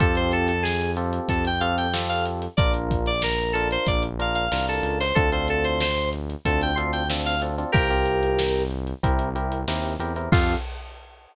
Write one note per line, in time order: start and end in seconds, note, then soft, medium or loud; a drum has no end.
0.00 1.20 F2 medium
0.00 0.52 C4 medium
0.00 0.52 F4 loud
0.00 0.52 G4 medium
0.00 0.52 A4 medium
0.00 0.15 A4 medium
0.00 kick medium
0.00 closed hi-hat medium
0.15 0.32 C5 medium
0.15 closed hi-hat medium
0.32 0.48 A4 medium
0.32 closed hi-hat medium
0.48 0.63 A4 medium
0.48 closed hi-hat medium
0.63 0.92 G#4 medium
0.63 snare medium
0.81 closed hi-hat medium
0.97 1.48 C4 medium
0.97 1.48 F4 medium
0.97 1.48 G4 medium
0.97 1.48 A4 medium
0.97 closed hi-hat medium
1.13 closed hi-hat medium
1.29 2.48 F2 medium
1.29 1.44 A4 medium
1.29 kick medium
1.29 closed hi-hat medium
1.45 1.62 G5 medium
1.45 closed hi-hat medium
1.60 1.87 C4 medium
1.60 1.87 F4 medium
1.60 1.87 G4 medium
1.60 1.87 A4 medium
1.60 1.76 F5 medium
1.60 closed hi-hat medium
1.78 1.93 G5 medium
1.78 closed hi-hat medium
1.94 2.45 C4 medium
1.94 2.45 F4 medium
1.94 2.45 G4 medium
1.94 2.45 A4 medium
1.94 snare loud
2.09 2.24 F5 medium
2.09 closed hi-hat medium
2.26 closed hi-hat medium
2.42 closed hi-hat medium
2.57 3.77 A#1 medium
2.57 3.10 D4 medium
2.57 3.10 F4 medium
2.57 3.10 A#4 medium
2.57 2.72 D5 medium
2.57 kick loud
2.57 closed hi-hat loud
2.74 closed hi-hat medium
2.91 kick medium
2.91 closed hi-hat medium
3.06 3.22 D5 medium
3.06 closed hi-hat medium
3.22 3.54 A#4 medium
3.22 snare loud
3.38 closed hi-hat medium
3.53 4.06 D4 medium
3.53 4.06 F4 medium
3.53 3.68 A4 medium
3.53 4.06 A#4 medium
3.53 closed hi-hat medium
3.71 3.87 C5 medium
3.71 closed hi-hat medium
3.87 4.48 A#1 medium
3.87 4.03 D5 medium
3.87 kick medium
3.87 closed hi-hat medium
4.03 closed hi-hat medium
4.19 4.45 D4 medium
4.19 4.45 F4 medium
4.19 4.45 A#4 medium
4.19 4.35 F5 medium
4.19 closed hi-hat medium
4.35 4.66 F5 medium
4.35 closed hi-hat medium
4.52 4.81 C2 medium
4.52 5.03 D4 medium
4.52 5.03 F4 medium
4.52 5.03 A#4 medium
4.52 snare medium
4.68 4.98 A4 medium
4.68 closed hi-hat medium
4.83 5.12 C#2 medium
4.83 closed hi-hat medium
5.00 5.16 C5 medium
5.00 open hi-hat medium
5.15 6.35 D2 medium
5.15 5.29 C4 medium
5.15 5.29 D4 medium
5.15 5.29 F4 medium
5.15 5.30 A4 loud
5.15 5.29 A4 medium
5.15 kick medium
5.15 closed hi-hat medium
5.32 5.84 C4 medium
5.32 5.84 D4 medium
5.32 5.84 F4 medium
5.32 5.84 A4 medium
5.32 5.48 C5 medium
5.32 closed hi-hat medium
5.48 5.65 A4 medium
5.48 closed hi-hat medium
5.64 5.80 C5 medium
5.64 closed hi-hat medium
5.81 6.10 C5 medium
5.81 snare loud
5.97 closed hi-hat medium
6.13 closed hi-hat medium
6.30 closed hi-hat medium
6.45 7.65 D2 medium
6.45 6.71 C4 medium
6.45 6.71 D4 medium
6.45 6.71 F4 medium
6.45 6.71 A4 medium
6.45 6.61 A4 medium
6.45 kick medium
6.45 closed hi-hat medium
6.62 6.78 G5 medium
6.62 closed hi-hat medium
6.76 7.03 C4 medium
6.76 7.03 D4 medium
6.76 7.03 F4 medium
6.76 7.03 A4 medium
6.76 6.91 C6 medium
6.76 closed hi-hat medium
6.93 7.08 G5 medium
6.93 closed hi-hat medium
7.10 7.35 C4 medium
7.10 7.35 D4 medium
7.10 7.35 F4 medium
7.10 7.35 A4 medium
7.10 snare loud
7.26 7.41 F5 medium
7.26 closed hi-hat medium
7.42 7.55 C4 medium
7.42 7.55 D4 medium
7.42 7.55 F4 medium
7.42 7.55 A4 medium
7.42 closed hi-hat medium
7.58 7.71 C4 medium
7.58 7.71 D4 medium
7.58 7.71 F4 medium
7.58 7.71 A4 medium
7.58 closed hi-hat medium
7.72 8.94 C2 medium
7.72 7.87 C4 medium
7.72 7.87 F4 medium
7.72 8.63 G4 medium
7.72 7.87 G4 medium
7.72 8.63 A#4 medium
7.72 7.87 A#4 medium
7.72 kick loud
7.72 closed hi-hat medium
7.90 8.42 C4 medium
7.90 8.42 F4 medium
7.90 8.42 G4 medium
7.90 8.42 A#4 medium
7.90 closed hi-hat medium
8.06 closed hi-hat medium
8.23 closed hi-hat medium
8.39 snare loud
8.54 closed hi-hat medium
8.71 closed hi-hat medium
8.87 closed hi-hat medium
9.03 9.65 C2 medium
9.03 9.29 C4 loud
9.03 9.29 E4 medium
9.03 9.29 G4 medium
9.03 9.29 A#4 medium
9.03 kick medium
9.03 closed hi-hat medium
9.19 closed hi-hat medium
9.35 9.61 C4 medium
9.35 9.61 E4 medium
9.35 9.61 G4 medium
9.35 9.61 A#4 medium
9.35 closed hi-hat medium
9.52 closed hi-hat medium
9.68 9.97 D#2 medium
9.68 9.94 C4 medium
9.68 9.94 E4 medium
9.68 9.94 G4 medium
9.68 9.94 A#4 medium
9.68 snare medium
9.84 closed hi-hat medium
9.99 10.28 E2 medium
9.99 10.13 C4 medium
9.99 10.13 E4 medium
9.99 10.13 G4 medium
9.99 10.13 A#4 medium
9.99 closed hi-hat medium
10.16 10.29 C4 medium
10.16 10.29 E4 medium
10.16 10.29 G4 medium
10.16 10.29 A#4 medium
10.16 closed hi-hat medium
10.32 10.55 F2 loud
10.32 10.55 C4 loud
10.32 10.54 F4 loud
10.32 10.55 F4 loud
10.32 10.55 G4 loud
10.32 10.55 A4 loud
10.32 kick loud
10.32 crash loud